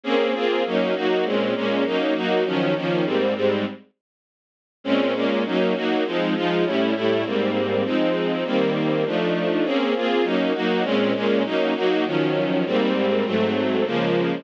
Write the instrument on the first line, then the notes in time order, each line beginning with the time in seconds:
string ensemble 1
0.04 A#3 C4 C#4 G#4
0.34 A#3 C4 F4 G#4
0.66 F#3 A#3 C#4 D#4
0.95 F#3 A#3 D#4 F#4
1.24 A#2 G#3 C4 C#4
1.55 A#2 G#3 A#3 C#4
1.85 F#3 A#3 C#4 D#4
2.14 F#3 A#3 D#4 F#4
2.45 D#3 F3 F#3 C#4
2.75 D#3 F3 A#3 C#4
3.04 G#2 G3 A#3 C4
3.35 G#2 G3 G#3 C4
4.84 A#2 G#3 C4 C#4
5.14 A#2 G#3 A#3 C#4
5.45 F#3 A#3 C#4 D#4
5.74 F#3 A#3 D#4 F#4
6.05 F3 G#3 C4 D#4
6.35 F3 G#3 D#4 F4
6.65 A2 G3 C#4 E4
6.94 A2 G3 A3 E4
7.24 G#2 G3 A#3 C4
7.84 F3 G#3 C4 D#4
8.45 D#3 G3 A#3 C4
9.05 F3 A3 D4 D#4
9.64 A#3 C4 C#4 G#4
9.95 A#3 C4 F4 G#4
10.23 F#3 A#3 C#4 D#4
10.54 F#3 A#3 D#4 F#4
10.83 A#2 G#3 C4 C#4
11.14 A#2 G#3 A#3 C#4
11.44 F#3 A#3 C#4 D#4
11.75 F#3 A#3 D#4 F#4
12.05 D#3 F3 F#3 C#4
12.65 G#2 G3 A#3 C4
13.24 G#2 F#3 A3 C4
13.85 C#3 F3 G#3 A#3